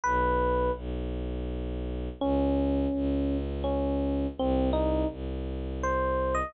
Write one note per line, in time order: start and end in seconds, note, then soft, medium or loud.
0.03 0.70 B1 medium
0.03 0.72 B4 medium
0.76 2.09 B1 medium
2.20 2.87 C#2 medium
2.20 3.37 C#4 medium
2.93 4.26 C#2 medium
3.64 4.27 C#4 medium
4.38 5.04 C2 medium
4.38 4.70 C4 medium
4.73 5.08 D#4 medium
5.10 6.43 C2 medium
5.83 6.35 C5 medium
6.35 6.52 D#5 medium